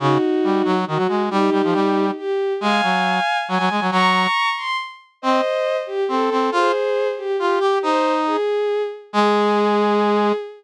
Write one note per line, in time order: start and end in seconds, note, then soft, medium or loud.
0.00 0.18 C#3 medium
0.00 0.74 D#4 medium
0.00 0.74 F#4 medium
0.44 0.62 G3 medium
0.65 0.85 F#3 medium
0.87 0.98 D#3 medium
0.87 1.22 F#4 medium
0.97 1.07 F#3 medium
1.08 1.29 G#3 medium
1.30 1.50 G3 medium
1.30 2.05 D#4 medium
1.30 2.05 G4 medium
1.52 1.62 G3 medium
1.64 1.74 F3 medium
1.73 2.11 G3 medium
2.17 2.53 G4 medium
2.61 2.81 G#3 medium
2.61 3.37 F5 medium
2.61 3.37 G#5 medium
2.83 3.20 F#3 medium
3.48 3.58 F#3 medium
3.48 3.84 G#5 medium
3.59 3.69 F#3 medium
3.70 3.80 G#3 medium
3.81 3.91 F#3 medium
3.91 4.27 F#3 medium
3.91 4.49 A#5 medium
3.91 4.49 C#6 medium
4.57 4.77 C6 medium
5.22 5.41 C4 medium
5.22 5.77 C5 medium
5.22 5.77 D#5 medium
5.87 6.04 G4 medium
6.08 6.30 C4 medium
6.08 6.49 A4 medium
6.31 6.50 C4 medium
6.52 6.72 F4 medium
6.52 7.08 G#4 medium
6.52 7.08 C5 medium
7.17 7.36 G4 medium
7.39 7.59 F4 medium
7.39 7.82 G4 medium
7.60 7.79 G4 medium
7.83 8.37 D#4 medium
7.83 8.13 C5 medium
8.26 8.82 G#4 medium
9.13 10.32 G#3 loud
9.13 10.33 G#4 loud